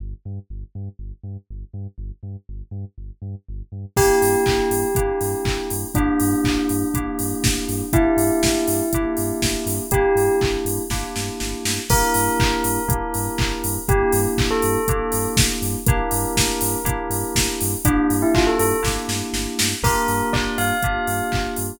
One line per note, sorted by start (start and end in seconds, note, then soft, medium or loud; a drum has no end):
0.00 0.14 G1 medium
0.25 0.39 G2 medium
0.50 0.64 G1 medium
0.75 0.89 G2 medium
0.99 1.13 G1 medium
1.23 1.37 G2 medium
1.50 1.64 G1 medium
1.74 1.87 G2 medium
1.98 2.11 G1 medium
2.23 2.36 G2 medium
2.49 2.63 G1 medium
2.71 2.85 G2 medium
2.98 3.11 G1 medium
3.22 3.35 G2 medium
3.49 3.62 G1 medium
3.72 3.86 G2 medium
3.96 4.11 G1 medium
3.96 4.86 A#3 loud
3.96 4.86 D4 medium
3.96 4.86 E4 loud
3.96 4.86 G4 medium
3.96 5.73 G4 loud
3.96 kick loud
3.96 crash loud
4.22 4.36 G2 medium
4.22 open hi-hat medium
4.46 4.61 G1 medium
4.46 kick medium
4.46 clap loud
4.71 4.84 G2 medium
4.71 open hi-hat medium
4.95 5.11 G1 medium
4.95 5.85 A#3 medium
4.95 5.85 D4 medium
4.95 5.85 E4 medium
4.95 5.85 G4 medium
4.95 kick loud
4.95 closed hi-hat loud
5.21 5.35 G2 medium
5.21 open hi-hat medium
5.45 5.58 G1 medium
5.45 kick medium
5.45 clap loud
5.70 5.84 G2 medium
5.70 open hi-hat medium
5.95 6.09 G1 medium
5.95 6.85 A#3 medium
5.95 7.88 D4 loud
5.95 6.85 D4 medium
5.95 6.85 E4 medium
5.95 6.85 G4 loud
5.95 kick loud
5.95 closed hi-hat loud
6.20 6.34 G2 medium
6.20 open hi-hat medium
6.44 6.58 A1 medium
6.44 kick medium
6.44 clap loud
6.69 6.84 G2 medium
6.69 open hi-hat medium
6.94 7.08 G1 medium
6.94 7.84 A#3 medium
6.94 7.84 D4 medium
6.94 7.84 E4 medium
6.94 7.84 G4 medium
6.94 kick medium
6.94 closed hi-hat loud
7.19 7.33 G2 medium
7.19 open hi-hat medium
7.44 7.59 G1 medium
7.44 kick loud
7.44 snare loud
7.69 7.82 G2 medium
7.69 open hi-hat medium
7.93 8.08 G1 medium
7.93 8.82 A#3 loud
7.93 8.82 D4 loud
7.93 8.82 E4 medium
7.93 9.73 E4 loud
7.93 8.82 G4 loud
7.93 kick loud
7.93 closed hi-hat loud
8.17 8.30 G2 medium
8.17 open hi-hat medium
8.43 8.57 G1 medium
8.43 kick medium
8.43 snare loud
8.67 8.82 G2 medium
8.67 open hi-hat medium
8.93 9.06 G1 medium
8.93 9.84 A#3 medium
8.93 9.84 D4 medium
8.93 9.84 E4 medium
8.93 9.84 G4 medium
8.93 kick medium
8.93 closed hi-hat loud
9.17 9.32 G2 medium
9.17 open hi-hat medium
9.42 9.56 G1 medium
9.42 kick medium
9.42 snare loud
9.66 9.80 G2 medium
9.66 open hi-hat medium
9.91 10.05 G1 medium
9.91 10.83 A#3 medium
9.91 10.83 D4 medium
9.91 10.83 E4 loud
9.91 10.35 G4 loud
9.91 10.83 G4 medium
9.91 kick loud
9.91 closed hi-hat loud
10.15 10.29 G2 medium
10.15 open hi-hat medium
10.41 10.57 G1 medium
10.41 kick medium
10.41 clap loud
10.65 10.79 G2 medium
10.65 open hi-hat medium
10.90 11.04 G1 medium
10.90 11.80 A#3 medium
10.90 11.80 D4 medium
10.90 11.80 E4 medium
10.90 11.80 G4 medium
10.90 kick medium
10.90 snare medium
11.16 11.30 G2 medium
11.16 snare medium
11.40 11.55 G1 medium
11.40 snare medium
11.65 11.79 G2 medium
11.65 snare loud
11.89 12.03 G1 medium
11.89 12.79 A#3 loud
11.89 12.79 D4 loud
11.89 12.79 E4 loud
11.89 12.79 G4 loud
11.89 13.70 A#4 loud
11.89 kick loud
11.89 crash loud
12.14 12.29 G2 medium
12.14 open hi-hat loud
12.40 12.54 G1 medium
12.40 kick loud
12.40 clap loud
12.64 12.78 G2 medium
12.64 open hi-hat medium
12.88 13.02 G1 medium
12.88 13.77 A#3 medium
12.88 13.77 D4 medium
12.88 13.77 E4 medium
12.88 13.77 G4 medium
12.88 kick loud
12.88 closed hi-hat loud
13.14 13.29 G2 medium
13.14 open hi-hat medium
13.38 13.53 G1 medium
13.38 kick loud
13.38 clap loud
13.64 13.78 G2 medium
13.64 open hi-hat medium
13.89 14.03 G1 loud
13.89 14.78 A#3 loud
13.89 14.78 D4 loud
13.89 14.78 E4 loud
13.89 14.12 G4 loud
13.89 14.78 G4 loud
13.89 kick loud
13.89 closed hi-hat loud
14.12 14.27 G2 medium
14.12 open hi-hat medium
14.37 14.51 A1 medium
14.37 kick loud
14.37 clap loud
14.51 15.28 A4 loud
14.62 14.77 G2 medium
14.62 open hi-hat medium
14.88 15.02 G1 medium
14.88 15.78 A#3 loud
14.88 15.78 D4 medium
14.88 15.78 E4 medium
14.88 15.78 G4 medium
14.88 kick loud
14.88 closed hi-hat loud
15.12 15.27 G2 medium
15.12 open hi-hat medium
15.36 15.50 G1 medium
15.36 kick loud
15.36 snare loud
15.62 15.76 G2 medium
15.62 open hi-hat medium
15.86 16.01 G1 medium
15.86 16.77 A#3 loud
15.86 16.77 D4 loud
15.86 16.77 E4 loud
15.86 16.77 G4 loud
15.86 17.47 A#4 loud
15.86 kick loud
15.86 closed hi-hat loud
16.11 16.25 G2 medium
16.11 open hi-hat loud
16.36 16.50 G1 medium
16.36 kick medium
16.36 snare loud
16.61 16.75 G2 medium
16.61 open hi-hat loud
16.84 16.98 G1 medium
16.84 17.74 A#3 medium
16.84 17.74 D4 medium
16.84 17.74 E4 loud
16.84 17.74 G4 loud
16.84 kick medium
16.84 closed hi-hat loud
17.10 17.24 G2 medium
17.10 open hi-hat medium
17.35 17.49 G1 medium
17.35 kick medium
17.35 snare loud
17.61 17.75 G2 medium
17.61 open hi-hat loud
17.85 17.99 G1 medium
17.85 18.74 A#3 loud
17.85 18.06 D4 loud
17.85 18.74 D4 loud
17.85 18.74 E4 loud
17.85 18.74 G4 loud
17.85 kick loud
17.85 closed hi-hat loud
18.10 18.24 G2 medium
18.10 open hi-hat medium
18.22 18.34 E4 loud
18.35 18.49 G1 medium
18.35 18.46 F4 loud
18.35 kick loud
18.35 clap loud
18.47 18.59 A4 medium
18.59 18.73 G2 medium
18.59 18.80 A4 medium
18.59 open hi-hat medium
18.83 18.98 G1 medium
18.83 19.72 A#3 medium
18.83 19.72 D4 medium
18.83 19.72 E4 loud
18.83 19.72 G4 medium
18.83 kick medium
18.83 snare medium
19.08 19.22 G2 medium
19.08 snare medium
19.33 19.47 G1 medium
19.33 snare medium
19.59 19.74 G2 medium
19.59 snare loud
19.83 19.96 G1 medium
19.83 20.73 A#3 loud
19.83 20.73 D4 loud
19.83 20.73 F4 medium
19.83 20.73 G4 loud
19.83 20.29 A#4 loud
19.83 kick loud
19.83 crash loud
20.08 20.22 G2 medium
20.08 open hi-hat medium
20.33 20.47 G1 medium
20.33 20.55 D5 loud
20.33 kick medium
20.33 clap loud
20.58 20.72 G2 medium
20.58 21.42 F5 loud
20.58 open hi-hat medium
20.82 20.98 G1 medium
20.82 21.73 A#3 medium
20.82 21.73 D4 medium
20.82 21.73 F4 medium
20.82 21.73 G4 medium
20.82 kick medium
20.82 closed hi-hat loud
21.07 21.21 G2 medium
21.07 open hi-hat medium
21.32 21.48 G1 medium
21.32 kick medium
21.32 clap loud
21.56 21.72 G2 medium
21.56 open hi-hat medium